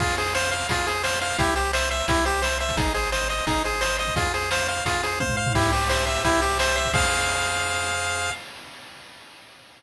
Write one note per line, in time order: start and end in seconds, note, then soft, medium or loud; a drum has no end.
0.00 0.64 F2 loud
0.00 0.16 F4 medium
0.00 0.16 G#4 loud
0.00 kick loud
0.00 crash medium
0.09 closed hi-hat medium
0.17 0.34 G#4 medium
0.17 0.34 C5 medium
0.17 closed hi-hat medium
0.26 closed hi-hat medium
0.34 0.51 C5 medium
0.34 0.50 F5 medium
0.34 snare loud
0.43 closed hi-hat medium
0.51 0.67 C5 medium
0.51 0.67 F5 medium
0.51 closed hi-hat medium
0.61 closed hi-hat medium
0.69 1.33 F2 medium
0.69 0.86 F4 medium
0.69 0.85 G#4 medium
0.69 kick medium
0.69 closed hi-hat loud
0.78 closed hi-hat medium
0.87 1.03 G#4 medium
0.87 1.03 C5 medium
0.87 closed hi-hat medium
0.95 closed hi-hat medium
1.03 1.19 C5 medium
1.03 1.20 F5 medium
1.03 snare loud
1.13 closed hi-hat medium
1.21 1.37 C5 medium
1.21 1.38 F5 medium
1.21 closed hi-hat medium
1.30 open hi-hat medium
1.38 2.03 C2 loud
1.38 1.54 E4 medium
1.38 1.55 G4 loud
1.38 kick loud
1.38 closed hi-hat loud
1.47 closed hi-hat medium
1.56 1.71 G4 medium
1.56 1.72 C5 medium
1.56 closed hi-hat medium
1.65 closed hi-hat medium
1.73 1.89 C5 medium
1.73 1.89 E5 medium
1.73 snare loud
1.82 closed hi-hat medium
1.91 2.06 C5 medium
1.91 2.07 E5 medium
1.91 closed hi-hat medium
1.99 closed hi-hat medium
2.08 2.72 C2 loud
2.08 2.25 E4 medium
2.08 2.24 G4 medium
2.08 kick loud
2.08 closed hi-hat loud
2.17 closed hi-hat medium
2.25 2.42 G4 medium
2.25 2.41 C5 medium
2.25 closed hi-hat medium
2.34 closed hi-hat medium
2.42 2.58 C5 medium
2.42 2.58 E5 medium
2.42 snare loud
2.51 closed hi-hat medium
2.60 2.76 C5 medium
2.60 2.76 E5 medium
2.60 closed hi-hat medium
2.69 kick medium
2.69 closed hi-hat medium
2.77 3.41 G#1 loud
2.77 2.93 D#4 medium
2.77 2.93 G#4 loud
2.77 kick loud
2.77 closed hi-hat loud
2.86 closed hi-hat medium
2.94 3.10 G#4 medium
2.94 3.10 C5 medium
2.94 closed hi-hat medium
3.03 closed hi-hat medium
3.12 3.28 C5 medium
3.12 3.28 D#5 medium
3.12 snare loud
3.21 closed hi-hat medium
3.29 3.45 C5 medium
3.29 3.46 D#5 medium
3.29 closed hi-hat medium
3.38 closed hi-hat medium
3.47 4.11 G#1 loud
3.47 3.63 D#4 medium
3.47 3.63 G#4 medium
3.47 kick medium
3.47 closed hi-hat loud
3.55 closed hi-hat medium
3.64 3.81 G#4 medium
3.64 3.80 C5 medium
3.64 closed hi-hat medium
3.73 closed hi-hat medium
3.81 3.97 C5 medium
3.81 3.98 D#5 medium
3.81 snare loud
3.90 closed hi-hat medium
3.99 4.14 C5 medium
3.99 4.15 D#5 medium
3.99 closed hi-hat medium
4.07 kick medium
4.07 closed hi-hat medium
4.16 4.80 F2 loud
4.16 4.33 F4 medium
4.16 4.32 G#4 loud
4.16 kick loud
4.16 closed hi-hat loud
4.25 closed hi-hat medium
4.34 4.50 G#4 medium
4.34 4.50 C5 medium
4.34 closed hi-hat medium
4.42 closed hi-hat medium
4.51 4.67 C5 medium
4.51 4.67 F5 medium
4.51 snare loud
4.60 closed hi-hat medium
4.68 4.84 C5 medium
4.68 4.84 F5 medium
4.68 closed hi-hat medium
4.77 closed hi-hat medium
4.85 5.49 F2 medium
4.85 5.02 F4 medium
4.85 5.01 G#4 medium
4.85 kick medium
4.85 closed hi-hat loud
4.94 closed hi-hat medium
5.03 5.19 G#4 medium
5.03 5.19 C5 medium
5.03 closed hi-hat medium
5.12 closed hi-hat medium
5.20 5.36 C5 medium
5.20 5.36 F5 medium
5.20 kick medium
5.20 high tom medium
5.29 floor tom medium
5.37 5.53 C5 medium
5.37 5.53 F5 medium
5.46 floor tom loud
5.55 6.19 C2 loud
5.55 5.71 E4 medium
5.55 6.24 G4 loud
5.55 kick loud
5.55 crash loud
5.64 closed hi-hat medium
5.72 5.89 G4 medium
5.72 6.06 C5 medium
5.72 closed hi-hat medium
5.81 closed hi-hat medium
5.89 6.05 C5 medium
5.89 6.58 E5 medium
5.89 snare loud
5.98 closed hi-hat medium
6.06 6.41 C5 medium
6.06 6.22 E5 medium
6.06 closed hi-hat medium
6.15 closed hi-hat medium
6.24 6.88 C2 medium
6.24 6.41 E4 loud
6.24 6.90 G4 loud
6.24 kick medium
6.24 closed hi-hat loud
6.33 closed hi-hat medium
6.41 6.58 G4 medium
6.41 6.76 C5 medium
6.41 closed hi-hat medium
6.50 closed hi-hat medium
6.59 6.76 C5 medium
6.59 6.92 E5 medium
6.59 snare loud
6.68 closed hi-hat medium
6.76 6.93 C5 medium
6.76 6.92 E5 medium
6.76 closed hi-hat medium
6.85 kick medium
6.85 closed hi-hat medium
6.93 8.30 F2 loud
6.93 8.30 G#4 loud
6.93 8.30 C5 loud
6.93 8.30 F5 loud
6.93 8.32 F5 loud
6.93 kick loud
6.93 crash loud